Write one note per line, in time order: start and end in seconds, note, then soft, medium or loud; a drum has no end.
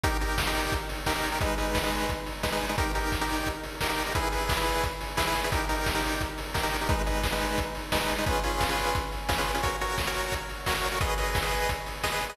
0.03 0.17 D#4 loud
0.03 0.17 G4 loud
0.03 0.17 A#4 medium
0.03 kick loud
0.03 closed hi-hat loud
0.21 0.42 D#4 medium
0.21 0.42 G4 medium
0.21 0.42 A#4 medium
0.21 open hi-hat medium
0.38 kick medium
0.38 snare loud
0.47 0.74 D#4 medium
0.47 0.74 G4 loud
0.47 0.74 A#4 medium
0.55 open hi-hat medium
0.72 kick loud
0.72 closed hi-hat loud
0.89 open hi-hat medium
1.06 1.13 D#4 medium
1.06 1.13 G4 medium
1.06 1.13 A#4 medium
1.06 kick medium
1.06 snare loud
1.16 1.29 D#4 medium
1.16 1.29 G4 medium
1.16 1.29 A#4 medium
1.23 open hi-hat medium
1.32 1.39 D#4 medium
1.32 1.39 G4 medium
1.32 1.39 A#4 medium
1.41 1.55 G#3 loud
1.41 1.55 D#4 loud
1.41 1.55 B4 loud
1.41 kick loud
1.41 closed hi-hat loud
1.58 1.78 G#3 medium
1.58 1.78 D#4 medium
1.58 1.78 B4 medium
1.58 open hi-hat medium
1.75 kick medium
1.75 snare loud
1.83 2.11 G#3 medium
1.83 2.11 D#4 medium
1.83 2.11 B4 medium
1.92 open hi-hat medium
2.09 kick medium
2.09 closed hi-hat loud
2.26 open hi-hat medium
2.43 2.50 G#3 medium
2.43 2.50 D#4 medium
2.43 2.50 B4 medium
2.43 kick medium
2.43 snare loud
2.52 2.66 G#3 medium
2.52 2.66 D#4 medium
2.52 2.66 B4 medium
2.61 open hi-hat medium
2.69 2.76 G#3 medium
2.69 2.76 D#4 medium
2.69 2.76 B4 medium
2.78 2.92 D#4 medium
2.78 2.92 G4 loud
2.78 2.92 A#4 loud
2.78 kick loud
2.78 closed hi-hat loud
2.95 3.15 D#4 medium
2.95 3.15 G4 medium
2.95 3.15 A#4 medium
2.95 open hi-hat medium
3.12 kick medium
3.12 snare medium
3.21 3.49 D#4 medium
3.21 3.49 G4 medium
3.21 3.49 A#4 medium
3.29 open hi-hat medium
3.46 kick medium
3.46 closed hi-hat loud
3.63 open hi-hat medium
3.81 3.88 D#4 medium
3.81 3.88 G4 medium
3.81 3.88 A#4 medium
3.81 kick medium
3.81 snare loud
3.89 4.03 D#4 medium
3.89 4.03 G4 medium
3.89 4.03 A#4 medium
3.98 open hi-hat medium
4.06 4.13 D#4 medium
4.06 4.13 G4 medium
4.06 4.13 A#4 medium
4.15 4.29 E4 loud
4.15 4.29 G#4 loud
4.15 4.29 B4 medium
4.15 kick loud
4.15 closed hi-hat loud
4.32 4.53 E4 medium
4.32 4.53 G#4 medium
4.32 4.53 B4 medium
4.32 open hi-hat medium
4.49 kick loud
4.49 snare loud
4.57 4.84 E4 medium
4.57 4.84 G#4 medium
4.57 4.84 B4 medium
4.66 open hi-hat medium
4.83 kick medium
4.83 closed hi-hat loud
5.01 open hi-hat medium
5.17 5.24 E4 medium
5.17 5.24 G#4 medium
5.17 5.24 B4 medium
5.17 kick medium
5.17 snare loud
5.27 5.41 E4 loud
5.27 5.41 G#4 medium
5.27 5.41 B4 medium
5.35 open hi-hat medium
5.44 5.51 E4 medium
5.44 5.51 G#4 medium
5.44 5.51 B4 medium
5.52 5.65 D#4 medium
5.52 5.65 G4 loud
5.52 5.65 A#4 medium
5.52 kick loud
5.52 closed hi-hat loud
5.69 5.90 D#4 medium
5.69 5.90 G4 medium
5.69 5.90 A#4 medium
5.69 open hi-hat medium
5.86 kick medium
5.86 snare loud
5.95 6.22 D#4 medium
5.95 6.22 G4 medium
5.95 6.22 A#4 medium
6.03 open hi-hat medium
6.21 kick medium
6.21 closed hi-hat loud
6.38 open hi-hat medium
6.54 6.61 D#4 medium
6.54 6.61 G4 medium
6.54 6.61 A#4 medium
6.54 kick medium
6.54 snare loud
6.63 6.77 D#4 medium
6.63 6.77 G4 medium
6.63 6.77 A#4 medium
6.72 open hi-hat medium
6.81 6.88 D#4 medium
6.81 6.88 G4 medium
6.81 6.88 A#4 medium
6.89 7.02 G#3 loud
6.89 7.02 D#4 medium
6.89 7.02 B4 medium
6.89 kick loud
6.89 closed hi-hat loud
7.06 7.27 G#3 medium
7.06 7.27 D#4 medium
7.06 7.27 B4 medium
7.06 open hi-hat medium
7.23 kick medium
7.23 snare loud
7.32 7.60 G#3 medium
7.32 7.60 D#4 medium
7.32 7.60 B4 medium
7.41 open hi-hat medium
7.58 kick medium
7.58 closed hi-hat loud
7.75 open hi-hat medium
7.92 7.99 G#3 medium
7.92 7.99 D#4 medium
7.92 7.99 B4 medium
7.92 kick medium
7.92 snare loud
8.01 8.15 G#3 medium
8.01 8.15 D#4 medium
8.01 8.15 B4 medium
8.09 open hi-hat medium
8.18 8.25 G#3 medium
8.18 8.25 D#4 medium
8.18 8.25 B4 medium
8.26 8.40 C#4 loud
8.26 8.40 F4 medium
8.26 8.40 G#4 medium
8.26 8.40 B4 loud
8.26 kick loud
8.26 closed hi-hat loud
8.43 8.64 C#4 medium
8.43 8.64 F4 medium
8.43 8.64 G#4 medium
8.43 8.64 B4 medium
8.43 open hi-hat medium
8.61 kick medium
8.61 snare loud
8.69 8.96 C#4 medium
8.69 8.96 F4 medium
8.69 8.96 G#4 medium
8.69 8.96 B4 medium
8.78 open hi-hat medium
8.95 kick loud
8.95 closed hi-hat loud
9.12 open hi-hat medium
9.28 9.35 C#4 medium
9.28 9.35 F4 medium
9.28 9.35 G#4 medium
9.28 9.35 B4 medium
9.28 kick medium
9.28 snare loud
9.38 9.52 C#4 medium
9.38 9.52 F4 medium
9.38 9.52 G#4 medium
9.38 9.52 B4 medium
9.46 open hi-hat medium
9.55 9.61 C#4 medium
9.55 9.61 F4 medium
9.55 9.61 G#4 medium
9.55 9.61 B4 medium
9.63 9.76 F#4 medium
9.63 9.76 A#4 medium
9.63 9.76 C#5 loud
9.63 kick medium
9.63 closed hi-hat loud
9.81 10.02 F#4 medium
9.81 10.02 A#4 medium
9.81 10.02 C#5 medium
9.81 open hi-hat medium
9.98 kick medium
9.98 snare loud
10.07 10.35 F#4 medium
10.07 10.35 A#4 medium
10.07 10.35 C#5 medium
10.15 open hi-hat medium
10.32 kick medium
10.32 closed hi-hat loud
10.49 open hi-hat medium
10.66 10.74 F#4 medium
10.66 10.74 A#4 medium
10.66 10.74 C#5 medium
10.66 kick medium
10.66 snare loud
10.75 10.89 F#4 medium
10.75 10.89 A#4 medium
10.75 10.89 C#5 medium
10.83 open hi-hat medium
10.92 10.99 F#4 medium
10.92 10.99 A#4 medium
10.92 10.99 C#5 medium
11.01 11.15 G#4 loud
11.01 11.15 B4 loud
11.01 11.15 D#5 loud
11.01 kick loud
11.01 closed hi-hat loud
11.18 11.38 G#4 medium
11.18 11.38 B4 medium
11.18 11.38 D#5 medium
11.18 open hi-hat medium
11.35 kick loud
11.35 snare loud
11.43 11.70 G#4 medium
11.43 11.70 B4 medium
11.43 11.70 D#5 medium
11.52 open hi-hat medium
11.69 kick medium
11.69 closed hi-hat loud
11.86 open hi-hat medium
12.03 12.10 G#4 medium
12.03 12.10 B4 medium
12.03 12.10 D#5 medium
12.03 kick medium
12.03 snare loud
12.12 12.26 G#4 medium
12.12 12.26 B4 loud
12.12 12.26 D#5 medium
12.21 open hi-hat medium
12.29 12.36 G#4 medium
12.29 12.36 B4 medium
12.29 12.36 D#5 medium